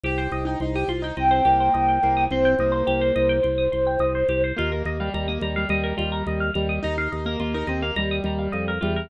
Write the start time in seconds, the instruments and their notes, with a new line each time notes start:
0.04 drawbar organ C2, pizzicato strings G4, acoustic grand piano G4
0.18 acoustic grand piano G4, pizzicato strings C5
0.32 drawbar organ C2, pizzicato strings D#5
0.45 acoustic grand piano D#4, pizzicato strings G5
0.60 drawbar organ C2, acoustic grand piano D#4, pizzicato strings C6
0.75 acoustic grand piano G4, pizzicato strings D#6
0.88 drawbar organ C2, acoustic grand piano F4, pizzicato strings C6
1.02 acoustic grand piano D#4, pizzicato strings G5
1.17 drawbar organ C2, acoustic grand piano C4, pizzicato strings D#5, flute G5
1.31 pizzicato strings C5
1.45 drawbar organ C2, acoustic grand piano A#3, pizzicato strings G4
1.60 pizzicato strings C5
1.74 drawbar organ C2, pizzicato strings D#5
1.89 pizzicato strings G5
2.03 drawbar organ C2, acoustic grand piano A#3, pizzicato strings C6
2.17 pizzicato strings D#6
2.30 drawbar organ C2, acoustic grand piano C4, flute C5, pizzicato strings C6
2.45 pizzicato strings G5
2.59 drawbar organ C2, acoustic grand piano A#3, pizzicato strings D#5
2.72 pizzicato strings C5
2.87 drawbar organ C2, pizzicato strings G4
3.01 pizzicato strings C5
3.16 drawbar organ C2, pizzicato strings D#5
3.29 pizzicato strings G5
3.43 drawbar organ C2, pizzicato strings C6
3.58 pizzicato strings D#6
3.72 drawbar organ C2, pizzicato strings C6
3.87 pizzicato strings G5
3.99 drawbar organ C2, pizzicato strings D#5
4.15 pizzicato strings C5
4.29 drawbar organ C2, pizzicato strings G4
4.44 pizzicato strings C5
4.56 drawbar organ D#2, acoustic grand piano A#3, pizzicato strings F4
4.71 acoustic grand piano A#3, pizzicato strings A#4
4.85 drawbar organ D#2, pizzicato strings D#5
5.00 acoustic grand piano G3, pizzicato strings F5
5.14 drawbar organ D#2, acoustic grand piano G3, pizzicato strings A#5
5.28 acoustic grand piano A#3, pizzicato strings D#6
5.41 drawbar organ D#2, acoustic grand piano G3, pizzicato strings A#5
5.56 acoustic grand piano G3, pizzicato strings F5
5.69 drawbar organ D#2, acoustic grand piano G3, pizzicato strings D#5
5.83 pizzicato strings A#4
5.97 drawbar organ D#2, acoustic grand piano G3, pizzicato strings F4
6.12 pizzicato strings A#4
6.27 drawbar organ D#2, pizzicato strings D#5
6.40 pizzicato strings F5
6.54 drawbar organ D#2, acoustic grand piano G3, pizzicato strings A#5
6.69 pizzicato strings D#6
6.83 drawbar organ D#2, acoustic grand piano D#4, pizzicato strings A#5
6.98 acoustic grand piano D#4, pizzicato strings F5
7.12 drawbar organ D#2, pizzicato strings D#5
7.26 acoustic grand piano A#3, pizzicato strings A#4
7.40 drawbar organ D#2, acoustic grand piano A#3, pizzicato strings F4
7.54 acoustic grand piano D#4, pizzicato strings A#4
7.67 drawbar organ D#2, acoustic grand piano C4, pizzicato strings D#5
7.82 acoustic grand piano A#3, pizzicato strings F5
7.96 drawbar organ D#2, acoustic grand piano G3, pizzicato strings A#5
8.11 pizzicato strings D#6
8.24 drawbar organ D#2, acoustic grand piano G3, pizzicato strings A#5
8.39 pizzicato strings F5
8.52 drawbar organ F2, pizzicato strings D#5
8.68 pizzicato strings A#4
8.81 drawbar organ E2, acoustic grand piano G3, pizzicato strings F4
8.96 pizzicato strings A#4